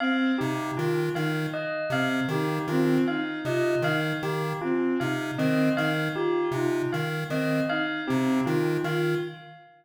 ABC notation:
X:1
M:2/4
L:1/8
Q:1/4=78
K:none
V:1 name="Lead 1 (square)" clef=bass
z C, _E, E, | z C, _E, E, | z C, _E, E, | z C, _E, E, |
z C, _E, E, | z C, _E, E, |]
V:2 name="Violin"
C _E F E | z C _E C | _E F E z | C _E C E |
F _E z C | _E C E F |]
V:3 name="Tubular Bells"
f G F f | _e f G F | f _e f G | F f _e f |
G F f _e | f G F f |]